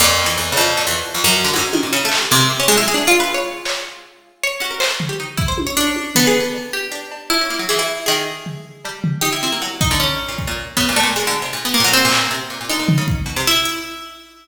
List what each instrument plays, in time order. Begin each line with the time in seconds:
0.00 harpsichord F2, pizzicato strings A#2
0.19 clap
0.26 pizzicato strings E3
0.37 harpsichord E2
0.52 pizzicato strings C#3
0.57 harpsichord F2
0.77 pizzicato strings A#2, cowbell
0.87 harpsichord E2
1.14 harpsichord F2
1.24 harpsichord F#2
1.44 pizzicato strings D3
1.54 harpsichord G#2, pizzicato strings F#3, high tom
1.73 pizzicato strings D#3, high tom
1.83 pizzicato strings A#2
1.93 pizzicato strings C#3
2.05 pizzicato strings A3
2.12 clap
2.18 pizzicato strings G3
2.31 harpsichord C3, pizzicato strings A#3
2.40 pizzicato strings G#3
2.50 pizzicato strings A#3
2.60 pizzicato strings C#4
2.68 harpsichord G#3, pizzicato strings A3
2.77 harpsichord E4
2.82 pizzicato strings F#3
2.88 harpsichord G#4
2.94 pizzicato strings D4
3.07 pizzicato strings F4, harpsichord F4
3.20 pizzicato strings B4
3.34 pizzicato strings C#5
3.65 pizzicato strings C#5, clap
4.44 pizzicato strings C#5
4.60 harpsichord C#4, pizzicato strings F#4
4.71 pizzicato strings A#4
4.80 pizzicato strings C5, clap
4.91 pizzicato strings A4
5.00 floor tom
5.09 pizzicato strings G4
5.20 pizzicato strings D#4
5.37 pizzicato strings E4, kick
5.48 pizzicato strings C5
5.58 high tom
5.67 pizzicato strings C#5
5.77 harpsichord D4, closed hi-hat
5.87 pizzicato strings C#5
5.96 high tom
6.15 harpsichord B3, pizzicato strings A4, floor tom
6.27 pizzicato strings G#4
6.40 pizzicato strings A4
6.54 cowbell
6.73 harpsichord G4
6.92 pizzicato strings D4
7.12 cowbell
7.30 harpsichord E4, cowbell
7.41 pizzicato strings C#4
7.50 pizzicato strings A#3
7.59 pizzicato strings F#3
7.69 pizzicato strings E3, harpsichord G#4
7.79 harpsichord E4
8.06 pizzicato strings D#3, harpsichord G#4
8.46 floor tom
8.85 pizzicato strings G3, cowbell
9.04 floor tom
9.21 pizzicato strings D#4, harpsichord G4
9.33 pizzicato strings E4
9.43 pizzicato strings C4, harpsichord E4
9.52 pizzicato strings A#3
9.62 pizzicato strings F#3, cowbell
9.81 harpsichord D#4, kick
9.91 pizzicato strings D3
10.00 harpsichord C#4
10.28 pizzicato strings A#2
10.38 kick
10.47 pizzicato strings A#2
10.77 pizzicato strings C#3, harpsichord B3, kick
10.89 pizzicato strings A#2
10.96 harpsichord A3, cowbell
11.03 pizzicato strings A#2
11.16 pizzicato strings F#3, harpsichord G#3
11.27 pizzicato strings D3
11.42 pizzicato strings C3
11.53 pizzicato strings A#2
11.65 harpsichord B3
11.74 harpsichord A#3
11.80 pizzicato strings A#2
11.84 harpsichord F#3
11.93 harpsichord C4
12.05 pizzicato strings A#2
12.12 clap
12.31 pizzicato strings C3
12.50 pizzicato strings A#2
12.61 pizzicato strings A#2
12.69 pizzicato strings D3, harpsichord D#4
12.79 pizzicato strings A#2
12.88 floor tom
12.98 pizzicato strings C#3
13.08 kick
13.26 pizzicato strings B2
13.36 pizzicato strings C3
13.47 harpsichord E4
13.65 closed hi-hat